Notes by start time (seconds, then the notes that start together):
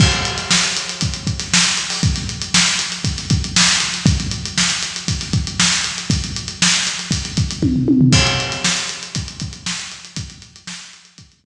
0.00 kick, crash
0.12 closed hi-hat
0.25 closed hi-hat
0.38 snare, closed hi-hat
0.51 snare
0.63 closed hi-hat
0.77 closed hi-hat
0.89 closed hi-hat
1.01 kick, closed hi-hat
1.14 closed hi-hat
1.27 kick, closed hi-hat
1.40 snare, closed hi-hat
1.53 snare
1.64 closed hi-hat
1.77 closed hi-hat
1.90 open hi-hat
2.03 kick, closed hi-hat
2.16 snare, closed hi-hat
2.29 closed hi-hat
2.42 closed hi-hat
2.54 snare
2.67 closed hi-hat
2.79 snare, closed hi-hat
2.92 closed hi-hat
3.04 kick, closed hi-hat
3.17 snare, closed hi-hat
3.30 kick, closed hi-hat
3.44 closed hi-hat
3.56 snare
3.69 closed hi-hat
3.80 closed hi-hat
3.94 closed hi-hat
4.06 kick, closed hi-hat
4.20 closed hi-hat
4.31 closed hi-hat
4.45 closed hi-hat
4.58 snare
4.70 snare, closed hi-hat
4.83 closed hi-hat
4.96 closed hi-hat
5.08 kick, closed hi-hat
5.21 snare, closed hi-hat
5.33 kick, closed hi-hat
5.47 closed hi-hat
5.60 snare
5.73 closed hi-hat
5.84 closed hi-hat
5.98 closed hi-hat
6.10 kick, closed hi-hat
6.24 closed hi-hat
6.36 closed hi-hat
6.48 closed hi-hat
6.62 snare
6.74 closed hi-hat
6.87 snare, closed hi-hat
6.99 closed hi-hat
7.11 kick, closed hi-hat
7.25 closed hi-hat
7.37 kick, closed hi-hat
7.51 closed hi-hat
7.62 kick, high tom
7.76 floor tom
7.88 high tom
8.01 floor tom
8.13 kick, crash
8.27 closed hi-hat
8.40 closed hi-hat
8.52 snare, closed hi-hat
8.64 snare
8.77 closed hi-hat
8.89 closed hi-hat
9.03 closed hi-hat
9.15 kick, closed hi-hat
9.28 closed hi-hat
9.40 kick, closed hi-hat
9.53 closed hi-hat
9.66 snare
9.79 closed hi-hat
9.92 closed hi-hat
10.05 closed hi-hat
10.16 kick, closed hi-hat
10.30 closed hi-hat
10.42 closed hi-hat
10.56 closed hi-hat
10.67 snare
10.80 closed hi-hat
10.93 closed hi-hat
11.05 closed hi-hat
11.18 kick, closed hi-hat
11.32 closed hi-hat
11.44 kick